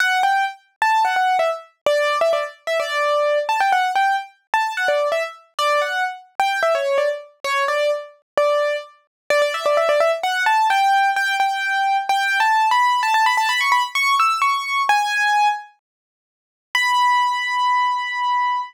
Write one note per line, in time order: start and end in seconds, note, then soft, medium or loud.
0.00 0.22 F#5 loud
0.23 0.45 G5 medium
0.82 1.03 A5 medium
1.04 1.16 F#5 medium
1.16 1.37 F#5 medium
1.39 1.50 E5 medium
1.86 2.18 D5 loud
2.21 2.32 E5 medium
2.33 2.44 D5 medium
2.67 2.78 E5 medium
2.79 3.39 D5 medium
3.49 3.60 A5 medium
3.60 3.71 G5 medium
3.72 3.91 F#5 medium
3.95 4.16 G5 medium
4.54 4.73 A5 medium
4.77 4.88 F#5 medium
4.88 5.08 D5 medium
5.12 5.23 E5 medium
5.59 5.80 D5 loud
5.81 6.04 F#5 medium
6.39 6.60 G5 medium
6.62 6.73 E5 medium
6.75 6.97 C#5 medium
6.98 7.09 D5 medium
7.44 7.64 C#5 medium
7.68 7.91 D5 medium
8.37 8.76 D5 medium
9.30 9.41 D5 loud
9.42 9.53 D5 loud
9.54 9.65 E5 medium
9.65 9.76 D5 medium
9.77 9.88 E5 medium
9.89 10.00 D5 loud
10.00 10.11 E5 loud
10.23 10.43 F#5 loud
10.46 10.67 A5 medium
10.70 11.10 G5 loud
11.16 11.35 G5 loud
11.40 11.97 G5 medium
12.09 12.39 G5 loud
12.40 12.68 A5 medium
12.71 13.01 B5 medium
13.03 13.13 A5 loud
13.14 13.25 A5 loud
13.26 13.37 B5 loud
13.37 13.48 A5 loud
13.49 13.60 B5 loud
13.60 13.72 C#6 medium
13.72 13.83 B5 loud
13.95 14.15 C#6 loud
14.19 14.41 E6 medium
14.41 14.82 C#6 medium
14.89 15.48 G#5 loud
16.75 18.61 B5 loud